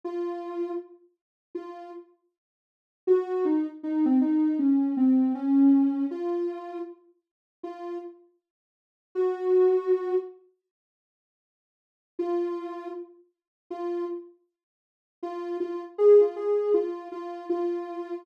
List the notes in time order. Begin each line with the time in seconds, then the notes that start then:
0.04 F4
1.55 F4
3.07 F#4
3.45 D#4
3.83 D#4
4.05 C4
4.21 D#4
4.59 C#4
4.97 C4
5.35 C#4
6.11 F4
7.63 F4
9.15 F#4
12.19 F4
13.70 F4
15.23 F4
15.60 F4
15.98 G#4
16.21 F4
16.36 G#4
16.74 F4
17.12 F4
17.50 F4